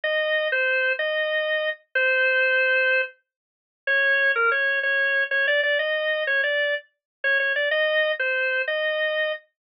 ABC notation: X:1
M:12/8
L:1/8
Q:3/8=125
K:Ab
V:1 name="Drawbar Organ"
e3 c3 e5 z | c7 z5 | d3 B d2 d3 d =d d | e3 d =d2 z3 _d d =d |
e3 c3 e5 z |]